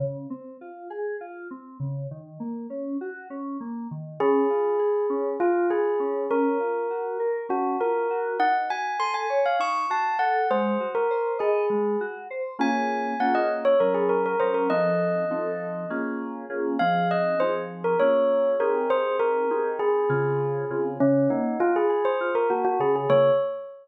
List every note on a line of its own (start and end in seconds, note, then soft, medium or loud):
0.00 0.26 C#3 medium
0.30 0.57 C4 medium
0.61 0.88 F4 medium
0.90 1.17 G#4 medium
1.21 1.48 F4 medium
1.51 1.78 C4 medium
1.80 2.07 C#3 medium
2.11 2.38 D#3 medium
2.40 2.67 A#3 medium
2.70 2.97 C#4 medium
3.01 3.28 F#4 medium
3.30 3.57 C#4 medium
3.60 3.87 A#3 medium
3.91 4.18 D#3 medium
4.20 4.47 C#4 loud
4.20 5.28 G#4 medium
4.50 4.77 F4 medium
4.79 5.06 G#4 medium
5.10 5.37 C#4 medium
5.40 5.67 F4 medium
5.40 5.69 F4 medium
5.70 5.97 G#4 medium
5.70 6.23 G#4 medium
6.00 6.27 C#4 medium
6.30 6.58 C#4 medium
6.30 7.39 A#4 medium
6.60 6.87 F4 medium
6.90 7.17 F#4 medium
7.20 7.47 A#4 medium
7.49 7.76 C#4 medium
7.49 7.77 F#4 medium
7.80 8.07 F4 medium
7.80 8.35 A#4 medium
8.10 8.37 F#4 medium
8.39 8.66 D#4 medium
8.39 8.54 F#5 medium
8.70 8.97 F#4 medium
8.70 8.96 G#5 medium
8.99 9.26 A4 medium
8.99 9.14 C6 medium
9.14 9.40 G#5 medium
9.30 9.57 C#5 medium
9.46 9.60 F5 medium
9.59 9.86 D#4 medium
9.59 9.85 C#6 medium
9.90 10.17 F#4 medium
9.90 10.15 A5 medium
10.19 10.46 A4 medium
10.19 10.47 F#5 medium
10.51 10.78 G#3 loud
10.51 10.88 C5 medium
10.80 11.07 F#4 medium
10.95 11.32 A#4 medium
11.11 11.38 C5 medium
11.39 11.96 G#4 medium
11.39 11.66 D#5 medium
11.70 11.97 G#3 medium
12.01 12.28 F#4 medium
12.30 12.57 C5 medium
12.59 13.14 A#3 medium
12.59 13.14 C#4 medium
12.59 13.14 F4 medium
12.59 13.14 G#4 medium
12.59 13.18 G#5 medium
13.20 13.75 A#3 medium
13.20 13.75 C#4 medium
13.20 13.75 F4 medium
13.20 13.75 G#4 medium
13.20 13.34 F#5 medium
13.35 13.49 D#5 medium
13.65 13.79 C#5 medium
13.80 14.35 F#3 medium
13.80 14.35 C#4 medium
13.80 13.94 A#4 medium
13.80 14.35 A#4 medium
13.94 14.09 G#4 medium
14.09 14.23 A#4 medium
14.26 14.40 A#4 medium
14.40 14.68 F#3 medium
14.40 14.68 C#4 medium
14.40 14.68 A#4 medium
14.40 14.54 C5 medium
14.54 14.69 A#4 medium
14.70 15.25 F3 medium
14.70 15.25 C4 medium
14.70 15.25 D#4 loud
14.70 15.25 A4 medium
14.70 15.92 D#5 medium
15.30 15.86 F3 medium
15.30 15.86 C4 medium
15.30 15.86 D#4 medium
15.30 15.86 A4 medium
15.90 16.45 A#3 medium
15.90 16.45 C#4 medium
15.90 16.45 F4 medium
15.90 16.45 G#4 medium
16.50 16.77 A#3 medium
16.50 16.77 C#4 medium
16.50 16.77 F4 medium
16.50 16.77 G#4 medium
16.79 17.35 F3 medium
16.79 17.35 C4 medium
16.79 17.35 D#4 medium
16.79 17.35 G#4 medium
16.79 17.08 F5 medium
17.11 17.40 D#5 medium
17.40 17.96 F3 medium
17.40 17.96 C4 medium
17.40 17.96 D#4 medium
17.40 17.96 G#4 medium
17.40 17.54 C5 medium
17.84 17.98 A#4 medium
18.00 18.55 A#3 medium
18.00 18.55 C#4 medium
18.00 18.55 F4 medium
18.00 18.55 G#4 medium
18.00 18.50 C#5 medium
18.60 19.45 C4 medium
18.60 19.45 D#4 medium
18.60 19.45 G4 medium
18.60 19.45 G#4 loud
18.60 18.89 A#4 medium
18.90 19.16 C5 medium
19.20 19.69 A#4 medium
19.50 20.05 C4 medium
19.50 20.05 D#4 medium
19.50 20.05 G4 medium
19.50 20.05 G#4 medium
19.79 20.79 G#4 medium
20.09 20.65 C#3 medium
20.09 20.65 C4 medium
20.09 20.65 F4 loud
20.09 20.65 G#4 medium
20.70 20.98 C#3 medium
20.70 20.98 C4 medium
20.70 20.98 F4 medium
20.70 20.98 G#4 medium
21.00 21.28 C#3 loud
21.00 21.28 C#4 medium
21.30 21.57 A#3 medium
21.30 21.58 D#4 medium
21.60 21.87 F4 medium
21.60 21.74 F4 medium
21.76 22.05 G#4 medium
21.89 22.16 G#4 medium
22.05 22.34 C5 medium
22.21 22.48 F4 medium
22.35 22.49 A#4 medium
22.50 22.77 A#3 medium
22.50 22.64 F#4 medium
22.65 22.79 F#4 medium
22.80 23.07 C#3 medium
22.80 22.95 G#4 medium
22.96 23.10 G#4 medium
23.09 23.30 C#3 loud
23.09 23.30 A#3 loud
23.09 23.30 F4 loud
23.09 23.30 G#4 loud
23.09 23.31 C#5 loud